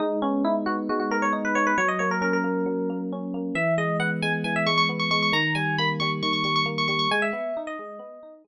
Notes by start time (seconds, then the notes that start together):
0.00 G#3 D#4
0.22 B3 C#4
0.45 D#4 E4
0.66 B3 F#4
0.89 G#3 F#4
1.00 F#4
1.11 B3 A#4
1.22 C#5
1.33 D#4
1.45 B4
1.55 B3 C#5
1.67 B4
1.78 F#3 C#5
1.88 D#5
1.99 A#3 C#5
2.11 A#4
2.21 C#4 A#4
2.33 A#4
2.44 A#3
2.66 F#3
2.90 A#3
3.12 C#4
3.34 A#3
3.55 E3 E5
3.78 G#3 D#5
4.00 B3 F#5
4.22 G#3 G#5
4.44 E3 G#5
4.56 E5
4.66 G#3 C#6
4.78 C#6
4.89 B3
4.99 C#6
5.11 G#3 C#6
5.22 C#6
5.32 D#3 A#5
5.55 G3 G#5
5.78 A#3 B5
6.00 G3 C#6
6.22 D#3 C#6
6.33 C#6
6.44 G3 C#6
6.56 C#6
6.66 A#3
6.78 C#6
6.88 G3 C#6
6.99 C#6
7.11 G#3 G#5
7.22 E5
7.33 B3
7.57 D#4
7.67 D#5
7.79 G#3
7.99 B3
8.23 D#4
8.44 G#3